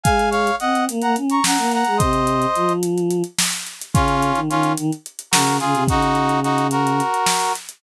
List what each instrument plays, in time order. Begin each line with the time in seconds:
0.03 choir aahs G#3, brass section F5 G#5, kick, closed hi-hat
0.19 closed hi-hat
0.31 brass section C#5 F5, closed hi-hat
0.47 closed hi-hat
0.60 choir aahs C4, brass section D#5 F#5, closed hi-hat
0.75 closed hi-hat
0.89 choir aahs A#3, closed hi-hat
1.02 choir aahs A#3, brass section F#5 A#5, closed hi-hat
1.16 choir aahs C#4, closed hi-hat
1.30 brass section A#5 C#6, closed hi-hat
1.44 choir aahs C#4, brass section F#5 A#5, snare
1.58 choir aahs A#3, closed hi-hat
1.71 brass section F#5 A#5, closed hi-hat
1.84 choir aahs G#3, closed hi-hat
1.97 choir aahs C3, brass section C5 D#5, kick, closed hi-hat
2.13 closed hi-hat
2.27 closed hi-hat
2.42 closed hi-hat
2.55 choir aahs F3, closed hi-hat
2.69 closed hi-hat
2.83 closed hi-hat
2.98 closed hi-hat
3.10 closed hi-hat
3.24 closed hi-hat
3.38 snare
3.53 closed hi-hat
3.66 closed hi-hat
3.81 closed hi-hat
3.94 choir aahs C#3, brass section C#4 F4, kick, closed hi-hat
4.08 closed hi-hat
4.22 closed hi-hat
4.35 choir aahs D#3, closed hi-hat
4.50 choir aahs D#3, brass section C#4 F4, closed hi-hat
4.63 closed hi-hat
4.77 choir aahs D#3, closed hi-hat
4.92 closed hi-hat
5.06 closed hi-hat
5.19 closed hi-hat
5.31 choir aahs C#3, brass section F#4 A#4, snare
5.47 closed hi-hat
5.60 choir aahs C#3, brass section F4 G#4, closed hi-hat
5.74 choir aahs C3, closed hi-hat
5.88 choir aahs C#3, brass section D#4 F#4, kick, closed hi-hat
6.02 closed hi-hat
6.15 closed hi-hat
6.29 closed hi-hat
6.43 brass section D#4 F#4, closed hi-hat
6.58 closed hi-hat
6.71 brass section F#4 A#4, closed hi-hat
6.87 closed hi-hat
7.00 closed hi-hat
7.14 closed hi-hat
7.26 snare
7.41 closed hi-hat
7.55 closed hi-hat
7.69 closed hi-hat